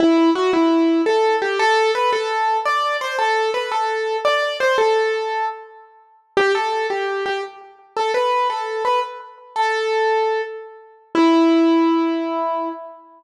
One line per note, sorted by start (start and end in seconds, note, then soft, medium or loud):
0.00 0.30 E4 medium
0.35 0.51 F#4 medium
0.53 1.02 E4 medium
1.06 1.36 A4 medium
1.42 1.59 G4 medium
1.59 1.91 A4 loud
1.95 2.11 B4 medium
2.13 2.57 A4 medium
2.65 2.97 D5 medium
3.01 3.16 C5 medium
3.19 3.51 A4 medium
3.54 3.70 B4 medium
3.72 4.17 A4 medium
4.25 4.57 D5 medium
4.60 4.77 C5 medium
4.78 5.46 A4 medium
6.37 6.52 G4 loud
6.55 6.87 A4 medium
6.90 7.24 G4 medium
7.26 7.41 G4 medium
7.97 8.12 A4 medium
8.14 8.48 B4 medium
8.50 8.83 A4 medium
8.85 9.00 B4 medium
9.56 10.42 A4 medium
11.15 12.69 E4 loud